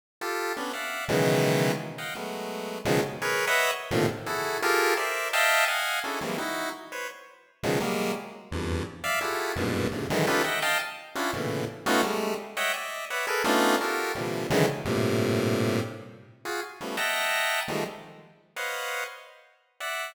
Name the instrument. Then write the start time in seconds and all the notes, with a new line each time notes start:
lead 1 (square)
0.21 F4 G4 A4
0.57 B3 C#4 D4
0.73 D5 E5 F5 F#5
1.09 B2 C#3 D#3 E3 F#3 G#3
1.98 D#5 F5 F#5 G5
2.15 F#3 G#3 A3 B3
2.85 B2 C#3 D#3 F3 F#3 G#3
3.22 G#4 A#4 B4 C#5
3.47 B4 C#5 D#5 E5 F#5
3.91 A2 A#2 C3 D3 D#3 F3
4.26 E4 F#4 G#4 A4
4.62 F4 G4 G#4 A4 A#4
4.97 A#4 C5 D5 E5
5.33 D#5 E5 F5 G5 A5
5.68 D#5 F5 F#5 G#5
6.04 C#4 D4 E4 F#4 G#4 A4
6.21 E3 F#3 G3 G#3 A#3 C4
6.38 D#4 E4 F#4
6.92 B4 C5 C#5
7.63 B2 C#3 D#3 F3 F#3 G#3
7.80 F#3 G3 G#3 A#3
8.51 E2 F2 G2
9.04 D5 E5 F5
9.21 E4 F4 F#4 G4 G#4 A4
9.56 F#2 G2 G#2 A#2 B2
9.91 G2 G#2 A#2 C3 C#3 D3
10.10 D3 D#3 E3 F#3 G#3
10.27 C#4 D#4 F4 G4 A4 B4
10.44 D#5 E5 F#5 G5
10.62 D#5 F5 G5 A5
11.15 C#4 D4 E4 F4 F#4
11.33 A2 A#2 B2 C#3 D3 E3
11.86 A3 B3 C#4 D#4 F4 F#4
12.03 G3 G#3 A3
12.57 C#5 D#5 E5 F#5 G5
12.74 D5 D#5 E5
13.10 B4 C#5 D5 E5 F#5
13.27 G#4 A4 A#4 B4
13.44 A3 B3 C#4 D4 D#4 F4
13.81 F4 F#4 G4 A4 A#4
14.15 A#2 C3 D3 E3 F3 G3
14.50 C#3 D3 D#3 E3 F#3 G#3
14.85 G2 A2 A#2 C3
16.45 F4 F#4 G#4
16.81 F3 G3 A3 B3 C#4
16.97 D#5 E5 F#5 G5 A5 A#5
17.68 D#3 F3 G3 G#3 A3
18.56 B4 C5 C#5 D#5 F5 F#5
19.80 D5 E5 F#5